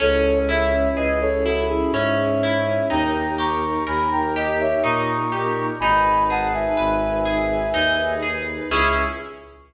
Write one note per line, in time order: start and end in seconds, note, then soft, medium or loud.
0.00 0.87 C#2 loud
0.00 1.93 C#4 medium
0.00 2.87 C#4 loud
0.00 2.87 E4 loud
0.00 2.87 G#4 medium
0.00 0.38 A4 loud
0.00 0.38 C#5 loud
0.49 1.45 E4 medium
0.49 0.88 C#5 medium
0.49 0.88 E5 loud
0.95 1.82 C#2 medium
0.95 2.81 G#4 medium
0.95 1.19 B4 medium
0.95 1.19 D#5 medium
1.21 1.44 A4 medium
1.21 1.44 C#5 loud
1.44 2.43 E4 medium
1.44 1.67 F#4 medium
1.44 1.67 A4 medium
1.68 1.91 E4 loud
1.68 1.91 G#4 loud
1.92 2.79 G#2 medium
1.92 2.86 C#4 medium
1.92 2.86 C#5 medium
1.92 2.86 E5 medium
2.43 2.89 E4 medium
2.90 3.77 D#2 loud
2.90 4.83 D#4 medium
2.90 5.78 D#4 loud
2.90 5.78 G4 loud
2.90 5.78 A#4 loud
2.90 3.35 G5 medium
2.90 3.35 A#5 loud
3.38 4.35 G4 medium
3.38 3.84 A#5 medium
3.38 3.84 C#6 loud
3.87 4.74 D#2 loud
3.87 5.71 A#4 medium
3.87 4.10 G#5 medium
3.87 4.10 B5 medium
4.11 4.34 G5 medium
4.11 4.34 A#5 loud
4.35 5.32 G4 medium
4.35 4.58 D#5 medium
4.35 4.58 G5 medium
4.60 4.82 C#5 medium
4.60 4.82 E5 medium
4.83 5.71 A#2 loud
4.83 5.75 D#4 medium
4.83 5.66 A#5 medium
4.83 5.66 C#6 medium
5.32 5.78 G4 medium
5.80 6.67 G#1 loud
5.80 8.68 D#4 loud
5.80 7.73 D#4 loud
5.80 8.68 G#4 medium
5.80 8.68 B4 loud
5.80 6.24 G#5 loud
5.80 6.24 B5 loud
6.30 7.25 G#4 medium
6.30 6.53 F#5 medium
6.30 6.53 A5 loud
6.53 8.15 E5 medium
6.53 8.15 G#5 loud
6.77 7.66 G#1 loud
6.77 8.61 B4 medium
7.25 8.22 G#4 medium
7.73 8.60 D#2 medium
7.73 8.66 D#4 medium
8.22 8.68 G#4 medium
8.70 9.03 C#2 loud
8.70 9.05 C#4 loud
8.70 9.05 E4 medium
8.70 9.05 G#4 medium
8.70 9.05 G#4 loud
8.70 9.05 C#6 loud